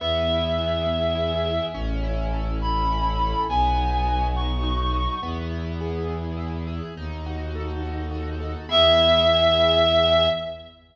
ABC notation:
X:1
M:6/8
L:1/8
Q:3/8=69
K:E
V:1 name="Clarinet"
e6 | z3 b3 | g3 c'3 | z6 |
z6 | e6 |]
V:2 name="Acoustic Grand Piano"
B, E G B, E G | C E A C E A | B, D F B, D F | B, E G B, E G |
D F A D F A | [B,EG]6 |]
V:3 name="Violin" clef=bass
E,,6 | A,,,6 | B,,,6 | E,,6 |
D,,6 | E,,6 |]